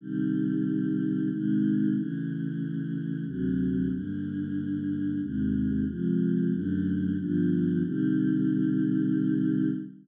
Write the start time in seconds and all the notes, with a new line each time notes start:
0.01 C3 D#3 G3
1.31 C3 D#3 G#3
1.95 C#3 E3 A3
3.26 D2 C3 F#3 A3
3.91 G2 D3 A#3
5.21 D#2 C3 G#3
5.87 C3 F3 G#3
6.51 F#2 D3 A3
7.18 G2 D3 F3 B3
7.83 C3 D#3 G3